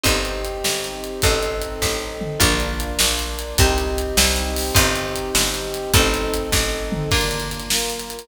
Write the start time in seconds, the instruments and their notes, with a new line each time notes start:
0.04 electric bass (finger) G1, orchestral harp C4 D#4 G4, brass section C4 D#4 G4, kick, closed hi-hat
0.25 closed hi-hat
0.45 closed hi-hat
0.64 electric bass (finger) G1, snare
0.84 closed hi-hat
1.04 closed hi-hat
1.22 electric bass (finger) A1, brass section C4 D#4 A4, orchestral harp C4 D#4 A4, kick, closed hi-hat
1.43 closed hi-hat
1.62 closed hi-hat
1.82 electric bass (finger) A1, kick, snare
2.21 floor tom
2.40 electric bass (finger) A#1, brass section A#3 D4 F4, orchestral harp D4 F4 A#4, kick, closed hi-hat
2.60 closed hi-hat
2.80 closed hi-hat
2.99 electric bass (finger) A#1, snare
3.19 closed hi-hat
3.39 closed hi-hat
3.58 electric bass (finger) C2, brass section C4 D#4 G4, orchestral harp C4 D#4 G4, kick, closed hi-hat
3.78 closed hi-hat
3.98 closed hi-hat
4.17 electric bass (finger) C2, snare
4.36 closed hi-hat
4.56 open hi-hat
4.75 electric bass (finger) G1, orchestral harp C4 D#4 G4, brass section C4 D#4 G4, kick, closed hi-hat
4.96 closed hi-hat
5.16 closed hi-hat
5.35 electric bass (finger) G1, snare
5.54 closed hi-hat
5.74 closed hi-hat
5.93 electric bass (finger) A1, brass section C4 D#4 A4, orchestral harp C4 D#4 A4, kick, closed hi-hat
6.14 closed hi-hat
6.34 closed hi-hat
6.52 electric bass (finger) A1, kick, snare
6.92 floor tom
7.11 brass section A#3 D4 F4, orchestral harp A#3 D4 F4, kick, crash
7.21 closed hi-hat
7.31 closed hi-hat
7.40 closed hi-hat
7.51 closed hi-hat
7.60 closed hi-hat
7.69 brass section A#3 F4 A#4, snare
7.79 closed hi-hat
7.90 closed hi-hat
8.00 closed hi-hat
8.10 closed hi-hat
8.19 closed hi-hat